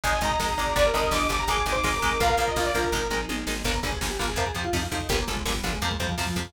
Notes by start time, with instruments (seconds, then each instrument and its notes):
0.04 electric bass (finger) G#1, overdriven guitar D#3 G#3, string ensemble 1 D#4 G#4, lead 1 (square) D#5, lead 2 (sawtooth) G#5, kick, closed hi-hat
0.13 kick
0.21 electric bass (finger) G#1, overdriven guitar D#3 G#3, lead 1 (square) D#5, lead 2 (sawtooth) A#5, kick, closed hi-hat
0.31 lead 2 (sawtooth) A#5, kick
0.40 electric bass (finger) G#1, overdriven guitar D#3 G#3, kick, snare
0.49 kick
0.58 electric bass (finger) G#1, overdriven guitar D#3 G#3, lead 1 (square) D5, kick, closed hi-hat
0.67 kick
0.76 electric bass (finger) G1, overdriven guitar D3 G3, string ensemble 1 D4 G4, lead 2 (sawtooth) D5, lead 1 (square) D5, kick, closed hi-hat
0.85 lead 2 (sawtooth) A#4, kick
0.94 electric bass (finger) G1, overdriven guitar D3 G3, lead 2 (sawtooth) A#4, lead 1 (square) D#5, kick, closed hi-hat
1.03 kick
1.11 electric bass (finger) G1, overdriven guitar D3 G3, lead 2 (sawtooth) D6, kick, snare
1.21 kick
1.29 electric bass (finger) G1, overdriven guitar D3 G3, lead 2 (sawtooth) D6, kick, closed hi-hat
1.39 lead 2 (sawtooth) A#5, kick
1.47 electric bass (finger) G#1, overdriven guitar D#3 G#3, string ensemble 1 D#4 G#4, lead 1 (square) G#4, lead 2 (sawtooth) D6, kick, closed hi-hat
1.57 kick
1.66 electric bass (finger) G#1, overdriven guitar D#3 G#3, lead 2 (sawtooth) D6, kick, closed hi-hat
1.72 lead 1 (square) C5, lead 2 (sawtooth) D6, kick
1.83 electric bass (finger) G#1, overdriven guitar D#3 G#3, kick, snare
1.93 lead 1 (square) A#4, kick
2.02 electric bass (finger) G#1, overdriven guitar D#3 G#3, kick, closed hi-hat
2.11 kick
2.20 electric bass (finger) A#1, overdriven guitar F3 A#3, string ensemble 1 F4 A#4, lead 1 (square) A#4, lead 2 (sawtooth) F5, kick, closed hi-hat
2.29 lead 1 (square) A#4, kick
2.37 electric bass (finger) A#1, overdriven guitar F3 A#3, lead 1 (square) A#4, kick, closed hi-hat
2.48 lead 2 (sawtooth) D#5, kick
2.56 electric bass (finger) A#1, overdriven guitar F3 A#3, lead 1 (square) F4, kick, snare
2.65 lead 2 (sawtooth) D5, kick
2.74 electric bass (finger) A#1, overdriven guitar F3 A#3, lead 2 (sawtooth) A#4, kick, closed hi-hat
2.84 kick
2.92 electric bass (finger) G#1, overdriven guitar D#3 G#3, string ensemble 1 D#4 G#4, kick, floor tom
3.10 electric bass (finger) G#1, overdriven guitar D#3 G#3, mid tom
3.29 electric bass (finger) G#1, overdriven guitar D#3 G#3, high tom
3.47 electric bass (finger) G#1, overdriven guitar D#3 G#3, snare
3.64 electric bass (finger) G1, overdriven guitar D3 G3 A#3, lead 1 (square) A#4, kick, crash
3.74 kick
3.83 electric bass (finger) G1, overdriven guitar D3 G3 A#3, lead 1 (square) G#4, kick, closed hi-hat
3.92 kick
4.01 electric bass (finger) G1, overdriven guitar D3 G3 A#3, lead 1 (square) G#4, kick, snare
4.10 lead 1 (square) G4
4.19 electric bass (finger) G1, overdriven guitar D3 G3 A#3, lead 1 (square) F4, kick, closed hi-hat
4.28 lead 1 (square) G#4, kick
4.36 electric bass (finger) F2, overdriven guitar C3 F3, lead 1 (square) A#4, kick, closed hi-hat
4.46 lead 1 (square) G#4, kick
4.55 electric bass (finger) F2, overdriven guitar C3 F3, lead 1 (square) G4, kick, closed hi-hat
4.64 lead 1 (square) F4, kick
4.73 electric bass (finger) F2, overdriven guitar C3 F3, lead 1 (square) D#4, kick, snare
4.82 lead 1 (square) F4, kick
4.91 electric bass (finger) F2, overdriven guitar C3 F3, lead 1 (square) D#4, kick, closed hi-hat
5.00 kick
5.09 electric bass (finger) G1, overdriven guitar A#2 D3 G3, lead 1 (square) A#3, kick, closed hi-hat
5.19 kick
5.27 electric bass (finger) G1, overdriven guitar A#2 D3 G3, lead 1 (square) G#3, kick, closed hi-hat
5.37 kick
5.45 electric bass (finger) G1, overdriven guitar A#2 D3 G3, lead 1 (square) G#3, kick, snare
5.55 lead 1 (square) G3, kick
5.63 electric bass (finger) G1, overdriven guitar A#2 D3 G3, lead 1 (square) F3, kick, closed hi-hat
5.73 lead 1 (square) G#3, kick
5.82 electric bass (finger) F2, overdriven guitar C3 F3, lead 1 (square) A#3, kick, closed hi-hat
5.91 lead 1 (square) G#3, kick
6.00 electric bass (finger) F2, overdriven guitar C3 F3, lead 1 (square) G3, kick, closed hi-hat
6.09 lead 1 (square) F3, kick
6.18 electric bass (finger) F2, overdriven guitar C3 F3, lead 1 (square) F3, kick, snare
6.27 lead 1 (square) F3, kick
6.36 electric bass (finger) F2, overdriven guitar C3 F3, lead 1 (square) F3, kick, closed hi-hat
6.45 kick